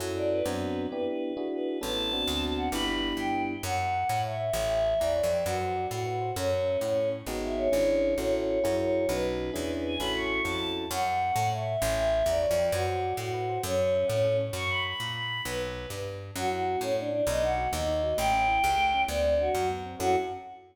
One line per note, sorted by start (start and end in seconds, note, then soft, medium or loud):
0.00 0.42 F#2 loud
0.00 0.41 C#4 loud
0.00 0.41 E4 loud
0.00 0.41 F#4 medium
0.00 0.41 A4 loud
0.16 0.29 D5 medium
0.30 0.87 B4 medium
0.45 0.87 F#2 loud
0.45 0.86 B3 loud
0.45 0.86 C4 loud
0.45 0.86 D4 loud
0.45 0.86 F#4 loud
0.91 1.33 B3 loud
0.91 1.33 D4 loud
0.91 1.33 E4 loud
0.91 1.33 G4 loud
0.91 1.04 B4 medium
1.06 1.48 B4 medium
1.37 1.78 D4 loud
1.37 1.78 E4 loud
1.37 1.78 F#4 loud
1.37 1.78 G#4 loud
1.51 1.79 B4 medium
1.81 2.25 A1 loud
1.81 2.10 B3 loud
1.81 2.10 C#4 loud
1.81 2.10 E4 loud
1.81 2.10 A4 loud
1.81 2.45 A5 medium
2.12 2.68 B3 loud
2.12 2.68 C4 loud
2.12 2.68 D4 loud
2.12 2.68 F#4 loud
2.27 2.69 D2 loud
2.57 2.69 F#5 medium
2.72 3.13 G1 loud
2.72 3.54 B3 loud
2.72 3.54 D4 loud
2.72 3.54 E4 loud
2.72 3.54 G4 loud
2.72 2.85 B5 medium
2.87 3.14 B5 medium
3.17 3.58 G2 medium
3.17 3.42 G5 medium
3.63 4.04 F#2 loud
3.63 3.77 C#5 medium
3.63 4.20 F#5 medium
3.78 3.91 E5 medium
3.94 4.08 F#5 medium
4.09 4.50 A2 loud
4.09 4.23 A5 medium
4.24 4.37 C#5 medium
4.24 4.52 E5 medium
4.40 4.53 E5 medium
4.53 4.94 A1 loud
4.53 4.69 C#5 medium
4.53 4.99 E5 medium
4.69 4.83 G5 medium
4.85 4.99 A5 medium
4.99 5.22 E2 medium
4.99 5.37 D5 medium
4.99 5.14 A#5 medium
5.16 5.29 C#5 medium
5.23 5.44 F2 loud
5.31 5.45 G5 medium
5.45 5.87 F#2 loud
5.45 5.85 F#4 medium
5.45 5.59 B4 medium
5.61 5.74 C5 medium
5.76 5.89 D5 medium
5.90 6.32 A2 medium
5.90 6.30 F#4 medium
5.90 6.05 F#5 medium
6.06 6.20 B4 medium
6.21 6.34 C5 medium
6.36 6.77 F#2 loud
6.36 6.78 C#4 medium
6.36 6.50 A4 medium
6.52 6.65 C#5 medium
6.66 6.80 E5 medium
6.81 7.22 A2 medium
6.81 7.08 C#4 medium
6.81 6.96 F#5 medium
6.97 7.11 A4 medium
7.12 7.25 C#5 medium
7.26 7.68 G#1 medium
7.26 7.68 B3 loud
7.26 7.68 D#4 loud
7.26 7.68 F#4 loud
7.26 7.68 G#4 loud
7.43 7.56 E5 medium
7.57 8.14 C#5 medium
7.72 8.15 G#1 medium
7.72 8.13 C#4 loud
7.72 8.13 D4 loud
7.72 8.13 E4 loud
7.72 8.13 G#4 loud
8.18 8.59 A1 medium
8.18 8.59 C#4 loud
8.18 8.59 E4 loud
8.18 8.59 F#4 loud
8.18 8.59 A4 loud
8.18 8.32 C#5 medium
8.34 8.76 C#5 medium
8.64 9.07 F#2 medium
8.64 9.05 E4 loud
8.64 9.05 F#4 loud
8.64 9.05 G#4 loud
8.64 9.05 A#4 loud
8.79 9.07 C#5 medium
9.09 9.51 B1 loud
9.09 9.50 C#4 loud
9.09 9.50 D#4 loud
9.09 9.50 F#4 loud
9.09 9.50 B4 loud
9.09 9.74 B4 medium
9.54 9.97 E2 loud
9.54 9.95 C#4 loud
9.54 9.95 D4 loud
9.54 9.95 E4 loud
9.54 9.95 G#4 loud
9.86 9.98 G#5 medium
9.99 10.41 A1 medium
9.99 10.41 C#4 loud
9.99 10.41 E4 loud
9.99 10.41 F#4 loud
9.99 10.41 A4 loud
9.99 10.12 B5 medium
10.15 10.42 C#6 medium
10.44 10.86 F2 medium
10.44 10.85 C#4 medium
10.44 10.85 E4 loud
10.44 10.85 F#4 medium
10.44 10.85 A4 medium
10.44 10.70 A5 medium
10.90 11.32 F#2 loud
10.90 11.04 C#5 medium
10.90 11.47 F#5 medium
11.06 11.19 E5 medium
11.21 11.35 F#5 medium
11.36 11.77 A2 loud
11.36 11.49 A5 medium
11.51 11.66 C#5 medium
11.51 11.80 E5 medium
11.67 11.81 E5 medium
11.81 12.23 A1 loud
11.81 11.96 C#5 medium
11.81 12.25 E5 medium
11.98 12.12 G5 medium
12.12 12.26 A5 medium
12.26 12.46 E2 loud
12.26 12.66 D5 medium
12.26 12.41 A#5 medium
12.42 12.56 C#5 medium
12.51 12.71 F2 loud
12.58 12.72 G5 medium
12.72 13.13 F#2 loud
12.72 13.13 F#4 medium
12.72 12.86 B4 medium
12.87 13.00 C5 medium
13.02 13.16 D5 medium
13.17 13.58 A2 loud
13.17 13.59 F#4 medium
13.17 13.32 F#5 medium
13.34 13.47 B4 medium
13.49 13.63 C5 medium
13.63 14.04 F#2 loud
13.63 14.06 C#4 medium
13.63 13.77 A4 medium
13.79 13.93 C#5 medium
13.94 14.07 E5 medium
14.08 14.50 A2 loud
14.08 14.37 C#4 medium
14.08 14.22 F#5 medium
14.24 14.38 A4 medium
14.40 14.54 C#5 medium
14.53 14.94 F#2 loud
14.53 14.69 C#6 medium
14.69 14.83 B5 medium
14.86 15.13 B5 medium
15.00 15.41 A#2 medium
15.15 15.41 B5 medium
15.45 15.86 B1 loud
15.45 15.89 B4 medium
15.90 16.31 G2 medium
16.36 16.76 F#2 loud
16.36 16.51 C#4 medium
16.36 16.50 F#4 medium
16.51 16.65 E4 medium
16.51 16.79 F#4 medium
16.67 16.81 F#4 medium
16.81 17.22 A2 loud
16.81 16.94 C#4 medium
16.81 16.97 A4 medium
16.97 17.10 C#4 medium
16.97 17.10 D4 medium
17.11 17.24 D4 medium
17.11 17.25 E4 medium
17.27 17.68 B1 loud
17.27 17.42 B3 medium
17.27 17.41 D#5 medium
17.43 17.56 D#4 medium
17.43 17.69 F#5 medium
17.57 17.71 F#4 medium
17.72 18.14 D#2 loud
17.72 17.85 B3 medium
17.72 18.15 D#5 medium
17.88 18.02 D#4 medium
18.03 18.17 F#4 medium
18.17 18.59 A1 loud
18.17 18.31 A3 medium
18.17 19.01 G5 medium
18.33 18.47 C#4 medium
18.48 18.62 E4 medium
18.63 19.05 C#2 loud
18.63 18.77 G4 medium
18.78 18.91 A3 medium
18.94 19.08 C#4 medium
19.08 19.49 D2 loud
19.08 19.23 B3 medium
19.08 19.35 D5 medium
19.24 19.38 C4 medium
19.38 19.52 D4 medium
19.38 19.68 F#4 medium
19.54 19.95 F#2 loud
19.54 19.68 F#4 medium
19.69 19.83 B3 medium
19.86 20.00 C4 medium
20.00 20.16 F#2 loud
20.00 20.15 C#4 loud
20.00 20.15 E4 loud
20.00 20.15 F#4 loud
20.00 20.16 F#4 loud
20.00 20.15 A4 loud